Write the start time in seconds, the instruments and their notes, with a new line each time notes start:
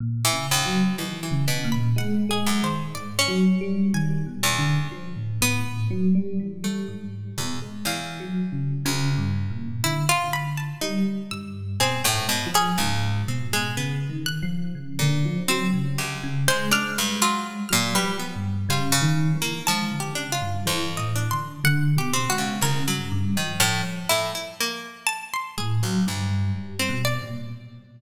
0.00 electric piano 1 A#2
0.25 pizzicato strings E3
0.33 electric piano 1 C#3
0.51 pizzicato strings D#2
0.65 electric piano 1 F#3
0.98 pizzicato strings D#2, electric piano 1 E3
1.23 pizzicato strings E3
1.31 electric piano 1 C#3
1.48 pizzicato strings B2
1.64 electric piano 1 A#2
1.72 harpsichord B5
1.96 electric piano 1 G#3, harpsichord F#5
2.29 electric piano 1 G#3, harpsichord G#4
2.47 pizzicato strings F#2
2.62 electric piano 1 D#3, harpsichord C5
2.95 electric piano 1 G#2, harpsichord D5
3.19 pizzicato strings C#4
3.28 electric piano 1 F#3
3.61 electric piano 1 G3
3.94 electric piano 1 D#3, harpsichord G#5
4.26 electric piano 1 B2
4.43 pizzicato strings E2
4.58 electric piano 1 D3
4.92 electric piano 1 F3
5.16 electric piano 1 A2
5.41 electric piano 1 A2, pizzicato strings B3
5.90 electric piano 1 F#3
6.15 electric piano 1 G3
6.40 electric piano 1 E3
6.64 electric piano 1 G3, pizzicato strings A3
6.88 electric piano 1 G#2
7.38 pizzicato strings E2, electric piano 1 B2
7.62 electric piano 1 G#3
7.85 pizzicato strings E2, electric piano 1 E3, harpsichord F5
8.20 electric piano 1 F#3
8.52 electric piano 1 C#3
8.85 pizzicato strings D2, electric piano 1 C#3
9.18 electric piano 1 G2
9.50 electric piano 1 A#2
9.84 electric piano 1 D3, harpsichord E4
10.09 harpsichord F4
10.33 harpsichord B5
10.57 harpsichord A5
10.81 electric piano 1 G3, pizzicato strings D#4
11.31 electric piano 1 G2, harpsichord E6
11.80 electric piano 1 B2, pizzicato strings C4, harpsichord G#4
12.04 pizzicato strings A2, harpsichord G5
12.14 electric piano 1 G#2
12.29 pizzicato strings B2
12.46 electric piano 1 F3
12.54 pizzicato strings C#4, harpsichord G#4
12.78 pizzicato strings C#2, electric piano 1 G#2
13.28 electric piano 1 B2, pizzicato strings C4
13.53 pizzicato strings G#3
13.77 electric piano 1 C#3, pizzicato strings B3
14.09 electric piano 1 D#3
14.26 harpsichord F#6
14.43 electric piano 1 F3
14.75 electric piano 1 C#3
14.99 pizzicato strings A#2, electric piano 1 D3
15.25 electric piano 1 F3
15.48 electric piano 1 F#3, pizzicato strings C4, harpsichord E6
15.74 electric piano 1 C#3
15.98 pizzicato strings C#2, harpsichord G4
16.23 electric piano 1 C#3
16.48 electric piano 1 G#3, pizzicato strings G#3, harpsichord C5
16.71 electric piano 1 G#3, pizzicato strings D4, harpsichord F6
16.98 pizzicato strings G2
17.22 pizzicato strings F#3, harpsichord F4
17.69 pizzicato strings A#2, electric piano 1 F#3, harpsichord F6
17.95 pizzicato strings G3, harpsichord B4
18.04 electric piano 1 F3
18.19 pizzicato strings B3
18.36 electric piano 1 G2
18.69 electric piano 1 C#3, pizzicato strings G3, harpsichord F4
18.92 pizzicato strings C#3
19.02 electric piano 1 D#3
19.35 electric piano 1 E3
19.42 pizzicato strings A#3
19.67 pizzicato strings F3, electric piano 1 G#3, harpsichord A5
19.91 electric piano 1 D3
20.00 harpsichord G4
20.15 electric piano 1 C#3, pizzicato strings D4
20.32 harpsichord F4
20.41 electric piano 1 G2
20.66 pizzicato strings F2, electric piano 1 E3, harpsichord C5
20.97 electric piano 1 A2, harpsichord D#5
21.16 pizzicato strings D4
21.31 electric piano 1 D3, harpsichord C6
21.64 electric piano 1 D3, harpsichord F#5
21.96 electric piano 1 B2, harpsichord G4
22.14 pizzicato strings C4
22.30 electric piano 1 G#3, harpsichord F#4
22.38 pizzicato strings C#3
22.61 pizzicato strings C2, electric piano 1 C#3, harpsichord A#4
22.87 electric piano 1 G2, pizzicato strings F#3
23.12 electric piano 1 G2
23.36 pizzicato strings D#3, electric piano 1 F3
23.60 pizzicato strings A2, electric piano 1 F3, harpsichord F6
24.09 pizzicato strings A2, harpsichord E4
24.35 pizzicato strings E4
24.60 pizzicato strings A#3
25.07 harpsichord A5
25.34 harpsichord C6
25.58 electric piano 1 A2, harpsichord G#4
25.82 pizzicato strings C#2, electric piano 1 F#3
26.07 pizzicato strings D2, electric piano 1 G2
26.55 electric piano 1 G3
26.79 pizzicato strings C4
26.89 electric piano 1 B2
27.05 harpsichord D5
27.22 electric piano 1 A#2